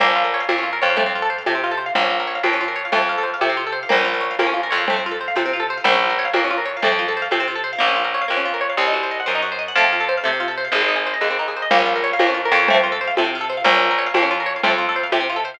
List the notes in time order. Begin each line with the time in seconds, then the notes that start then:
0.00 A#1 A#3, cowbell, low conga
0.10 C#4
0.16 F4
0.24 A#4
0.34 C#5
0.40 F5
0.49 F2 A#3, tambourine, cowbell, high conga
0.58 C#4
0.63 F4
0.73 A#4
0.82 F2 C#5
0.90 F5
0.97 A3, cowbell, low conga
1.06 C4
1.15 F4
1.22 A4
1.30 C5
1.38 F5
1.46 C3 A3, tambourine, cowbell, high conga
1.55 C4
1.64 F4
1.71 A4
1.77 C5
1.86 F5
1.95 A#1 A#3, cowbell, low conga
2.01 C#4
2.10 F4
2.20 A#4
2.27 C#5
2.35 F5
2.43 F2 A#3, tambourine, cowbell, high conga
2.53 C#4
2.61 F4
2.68 A#4
2.76 C#5
2.85 F5
2.92 F2 A3, cowbell, low conga
3.02 C4
3.09 F4
3.18 A4
3.23 C5
3.34 F5
3.41 C3 A3, tambourine, cowbell, high conga
3.50 C4
3.57 F4
3.67 A4
3.72 C5
3.83 F5
3.89 A#1 A#3, cowbell, low conga
3.98 C#4
4.05 F4
4.14 A#4
4.21 C#5
4.31 F5
4.39 F2 A#3, tambourine, cowbell, high conga
4.46 C#4
4.54 F4
4.63 A#4
4.71 F2 C#5
4.78 F5
4.88 A3, cowbell, low conga
4.96 C4
5.06 F4
5.11 A4
5.21 C5
5.28 F5
5.36 C3 A3, tambourine, cowbell, high conga
5.45 C4
5.53 F4
5.60 A4
5.70 C5
5.78 F5
5.84 A#1 A#3, cowbell, low conga
5.92 C#4
6.04 F4
6.10 A#4
6.19 C#5
6.25 F5
6.33 F2 A#3, tambourine, cowbell, high conga
6.44 C#4
6.50 F4
6.58 A#4
6.66 C#5
6.77 F5
6.82 F2 A3, cowbell, low conga
6.92 C4
6.99 F4
7.08 A4
7.17 C5
7.22 F5
7.31 C3 A3, tambourine, cowbell, high conga
7.40 C4
7.48 F4
7.55 A4
7.64 C5
7.73 F5
7.79 A#1 A#3
7.88 C#4
7.96 F4
8.04 A#4
8.14 C#5
8.21 F5
8.28 F2 A#3
8.37 C#4
8.45 F4
8.54 A#4
8.61 C#5
8.70 F5
8.77 C2 C4
8.87 D#4
8.94 F#4
9.03 C5
9.11 D#5
9.20 F#5
9.26 F#2 C4
9.35 D#4
9.42 F#4
9.52 C5
9.59 D#5
9.68 F#5
9.75 F2 A3
9.84 C4
9.92 F4
10.00 A4
10.09 C5
10.17 F5
10.24 C3 A3
10.33 C4
10.40 F4
10.48 A4
10.58 C5
10.65 F5
10.72 G#1 G#3
10.81 C4
10.88 D#4
10.96 G#4
11.07 C5
11.14 D#5
11.21 D#2 G#3
11.30 C4
11.39 D#4
11.48 G#4
11.56 C5
11.62 D#5
11.71 A#1 A#3, cowbell, low conga
11.79 C#4
11.86 F4
11.96 A#4
12.04 C#5
12.13 F5
12.19 F2 A#3, tambourine, cowbell, high conga
12.27 C#4
12.34 F4
12.45 A#4
12.52 F2 C#5
12.59 F5
12.68 A3, cowbell, low conga
12.74 C4
12.84 F4
12.92 A4
13.01 C5
13.08 F5
13.17 C3 A3, tambourine, cowbell, high conga
13.24 C4
13.35 F4
13.41 A4
13.50 C5
13.57 F5
13.64 A#1 A#3, cowbell, low conga
13.74 C#4
13.82 F4
13.91 A#4
13.99 C#5
14.06 F5
14.14 F2 A#3, tambourine, cowbell, high conga
14.22 C#4
14.31 F4
14.40 A#4
14.46 C#5
14.56 F5
14.63 F2 A3, cowbell, low conga
14.70 C4
14.78 F4
14.89 A4
14.96 C5
15.03 F5
15.12 C3 A3, tambourine, cowbell, high conga
15.21 C4
15.30 F4
15.36 A4
15.45 C5
15.54 F5